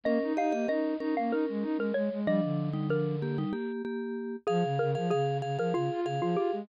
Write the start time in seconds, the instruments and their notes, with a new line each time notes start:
0.04 flute A#3, vibraphone C#4 A#4, xylophone D#5
0.23 flute D#4
0.37 flute D#4, vibraphone G4 D#5, xylophone F5
0.51 flute A#3, vibraphone G4 D#5
0.68 vibraphone C#4 A#4, flute D#4, xylophone D#5
1.00 vibraphone C#4 A#4, flute D#4
1.17 flute A#3, xylophone F5
1.31 flute D#4, xylophone A#4
1.49 flute G#3
1.62 flute D#4
1.77 flute G#3, xylophone A#4
1.94 flute G#3, xylophone C#5
2.11 flute G#3
2.26 vibraphone F3 D4, flute G3, xylophone D#5
2.43 flute D3
2.73 vibraphone G3 D#4
2.90 vibraphone F3 D4, xylophone A#4
3.22 vibraphone A#3 G4
3.38 vibraphone G3 D#4
3.53 vibraphone A#3 G4
3.85 vibraphone A#3 G4
4.47 flute F3, xylophone G#4, vibraphone G#4 F5
4.64 flute C#3
4.79 flute C#3, xylophone A#4
4.95 flute F3, vibraphone G#4 F5
5.10 flute C#3, xylophone G#4, vibraphone G#4 F5
5.42 flute C#3, vibraphone G#4 F5
5.58 flute F3, vibraphone G#4 F5, xylophone A#4
5.74 flute C#3, xylophone F4, vibraphone G#4 F5
5.91 flute F4
6.05 flute C#3, vibraphone G#4 F5
6.21 flute F3, xylophone F4
6.36 flute F4, xylophone G4
6.53 flute G#3